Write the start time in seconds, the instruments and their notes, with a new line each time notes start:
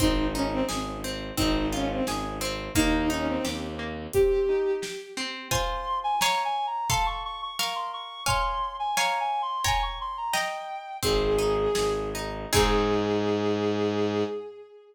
0.00 violin G#1 D#4, orchestral harp C4, kick, closed hi-hat
0.34 violin C#4, orchestral harp D#4
0.51 violin C4
0.69 violin G#1, orchestral harp G#4, snare
1.04 orchestral harp C4
1.37 violin G#1 D#4, orchestral harp C4, kick, closed hi-hat
1.72 violin C#4, orchestral harp F4
1.89 violin C4
2.07 violin G#1, orchestral harp G#4, snare
2.41 orchestral harp C4
2.75 violin D#2 D#4, orchestral harp A#3, kick, closed hi-hat
3.10 violin C#4, orchestral harp D#4
3.28 violin C4
3.45 violin D#2, orchestral harp G4, snare
3.79 orchestral harp A#3
4.13 orchestral harp C4, violin G4, kick, closed hi-hat
4.49 orchestral harp D#4
4.82 orchestral harp G4, snare
5.17 orchestral harp C4
5.51 orchestral harp F4 C5 G#5, clarinet C6, kick, floor tom
6.04 clarinet G#5
6.20 orchestral harp C#5 F5 G#5, clarinet A#5, snare
6.45 clarinet G#5
6.67 clarinet A#5
6.90 orchestral harp A4 F5 C6, clarinet A5, kick, floor tom
7.06 clarinet C#6
7.25 clarinet C#6
7.42 clarinet C#6
7.58 orchestral harp A#4 F5 C#6, clarinet C#6, snare
7.75 clarinet C6
7.93 clarinet C#6
8.26 orchestral harp C#5 F5 G#5, clarinet C6, kick, floor tom
8.79 clarinet G#5
8.97 orchestral harp C#5 F5 G#5, clarinet A#5, snare
9.20 clarinet G#5
9.42 clarinet C6
9.64 orchestral harp C#5 G5 A#5, clarinet G#5, kick, floor tom
9.82 clarinet C#6
10.01 clarinet C6
10.17 clarinet A#5
10.33 orchestral harp D#5 G5 A#5, clarinet G5, snare
11.03 violin G#1 G#4, orchestral harp C4, kick, closed hi-hat
11.39 orchestral harp D#4
11.75 violin G#1, orchestral harp G#4, snare
12.15 orchestral harp D#4
12.53 violin G#2 G#4, orchestral harp C4 D#4 G#4, kick, crash